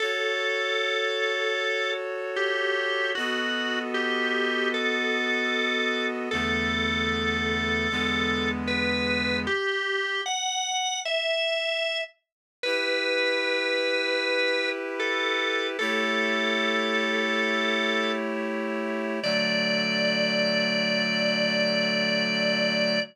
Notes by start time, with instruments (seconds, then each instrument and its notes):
0.00 clarinet F#4 A4 C#5, drawbar organ A4
2.36 drawbar organ G4
3.15 clarinet B3 F#4 A4 D#5, drawbar organ F#4
3.94 drawbar organ G4
4.74 drawbar organ A4
6.31 clarinet E2 D3 A3 B3, drawbar organ A4
7.90 clarinet E2 D3 G#3 B3
8.67 drawbar organ B4
9.47 drawbar organ G4
10.26 drawbar organ F#5
11.05 drawbar organ E5
12.63 clarinet E4 G4 B4, drawbar organ B4
15.00 drawbar organ A4
15.79 clarinet A3 E4 G4 C#5, drawbar organ A4
19.22 clarinet D3 F#3 A3, drawbar organ D5